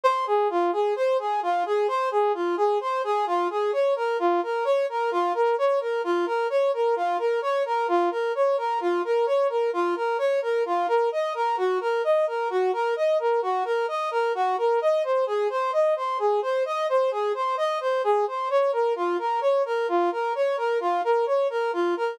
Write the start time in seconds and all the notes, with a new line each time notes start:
0.03 C5
0.27 G#4
0.50 F4
0.72 G#4
0.96 C5
1.19 G#4
1.42 F4
1.66 G#4
1.88 C5
2.11 G#4
2.34 F4
2.57 G#4
2.80 C5
3.04 G#4
3.26 F4
3.50 G#4
3.73 C#5
3.96 A#4
4.19 F4
4.43 A#4
4.64 C#5
4.89 A#4
5.11 F4
5.34 A#4
5.58 C#5
5.80 A#4
6.04 F4
6.26 A#4
6.50 C#5
6.73 A#4
6.96 F4
7.18 A#4
7.42 C#5
7.65 A#4
7.88 F4
8.11 A#4
8.35 C#5
8.57 A#4
8.80 F4
9.04 A#4
9.26 C#5
9.49 A#4
9.73 F4
9.96 A#4
10.18 C#5
10.42 A#4
10.65 F4
10.88 A#4
11.12 D#5
11.34 A#4
11.57 F#4
11.81 A#4
12.04 D#5
12.27 A#4
12.50 F#4
12.73 A#4
12.96 D#5
13.19 A#4
13.42 F#4
13.65 A#4
13.88 D#5
14.11 A#4
14.34 F#4
14.58 A#4
14.81 D#5
15.03 C5
15.26 G#4
15.50 C5
15.73 D#5
15.96 C5
16.19 G#4
16.42 C5
16.65 D#5
16.89 C5
17.11 G#4
17.34 C5
17.57 D#5
17.80 C5
18.03 G#4
18.27 C5
18.50 C#5
18.72 A#4
18.96 F4
19.18 A#4
19.41 C#5
19.65 A#4
19.88 F4
20.11 A#4
20.35 C#5
20.57 A#4
20.80 F4
21.04 A#4
21.26 C#5
21.50 A#4
21.73 F4
21.96 A#4